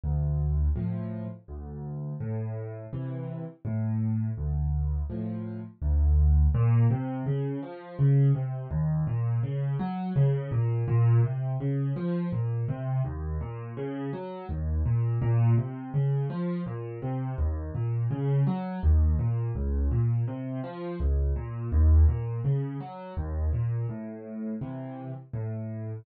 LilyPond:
\new Staff { \clef bass \time 3/4 \key a \minor \tempo 4 = 83 d,4 <a, f>4 d,4 | a,4 <c e>4 a,4 | d,4 <a, f>4 d,4 | \key bes \minor bes,8 c8 des8 f8 des8 c8 |
ees,8 bes,8 des8 ges8 des8 bes,8 | bes,8 c8 des8 f8 bes,8 c8 | ees,8 bes,8 des8 ges8 ees,8 bes,8 | bes,8 c8 des8 f8 bes,8 c8 |
ees,8 bes,8 des8 ges8 ees,8 bes,8 | des,8 bes,8 c8 f8 des,8 bes,8 | ees,8 bes,8 des8 ges8 ees,8 bes,8 | \key a \minor a,4 <c e>4 a,4 | }